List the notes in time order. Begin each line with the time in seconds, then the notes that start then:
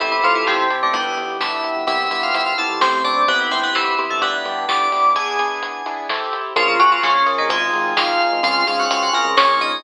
0.00 A1 E3 C4 E4 G4 A4, kick, closed hi-hat
0.12 E3 E4
0.23 A2 F3 C4 E4 F4 G4 A4, kick, closed hi-hat
0.35 E3 E4
0.47 A1 C3 C4, snare
0.70 C4 E4 G4 A4, closed hi-hat
0.82 A1 D3 D4
0.93 G1 G3 B3 D4 E4 G4, kick, closed hi-hat
1.17 G1, closed hi-hat
1.40 G1 B3 D4 E4 G4 E5, snare
1.64 closed hi-hat
1.76 G1
1.87 C2 B3 C4 E4 G4 E5, kick, closed hi-hat
2.10 G2 B3 C4 E4 G4 E5, closed hi-hat
2.23 F4 F5
2.33 C2 E4 E5, closed hi-hat
2.46 F4 F5
2.58 B3 C4 E4 G4 A4 A5, closed hi-hat
2.70 C2
2.80 A1 A3 C4 E4 G4 C5, snare
3.04 D4 D5, closed hi-hat
3.28 G1 B3 C4 E4 G4 B4, kick, closed hi-hat
3.40 B3 B4
3.51 G1 B3 C4 E4 G4 C5, kick, closed hi-hat
3.63 B3 B4
3.75 G1 E3 E4, snare
3.98 B3 C4 E4 G4, closed hi-hat
4.10 G1 A3 A4
4.21 G1 B3 D4 E4 G4 B4, kick, closed hi-hat
4.45 G2, closed hi-hat
4.68 G1 B3 D4 E4 G4 D5 D6, snare
4.92 B3 D4 E4 G4, open hi-hat
5.05 G1
5.16 B3 D4 E4 G#4 G#5, kick, closed hi-hat
5.39 B3 D4 E4 G#4, closed hi-hat
5.62 closed hi-hat
5.86 B3 D4 E4 G#4, closed hi-hat
6.09 C4 E4 G4 A4, snare
6.33 closed hi-hat
6.56 A#1 F3 C#4 F4 G#4 A#4, kick, closed hi-hat
6.68 F3 F4
6.79 A#2 F#3 C#4 F4 F#4 G#4 A#4, kick, closed hi-hat
6.92 F3 F4
7.03 A#1 C#3 C#4, snare
7.26 C#4 F4 G#4 A#4, closed hi-hat
7.38 A#1 D#3 D#4
7.50 G#1 G#3 C4 D#4 F4 G#4, kick, closed hi-hat
7.73 G#1, closed hi-hat
7.96 G#1 C4 D#4 F4 G#4 F5, snare
8.20 closed hi-hat
8.32 G#1
8.43 C#2 C4 C#4 F4 G#4 F5, kick, closed hi-hat
8.67 G#2 C4 C#4 F4 G#4 F5, closed hi-hat
8.79 F#4 F#5
8.90 C#2 F4 F5, closed hi-hat
9.03 F#4 F#5
9.13 C4 C#4 F4 G#4 A#4 A#5, closed hi-hat
9.25 C#2
9.37 A#1 A#3 C#4 F4 G#4 C#5, snare
9.61 D#4 D#5, closed hi-hat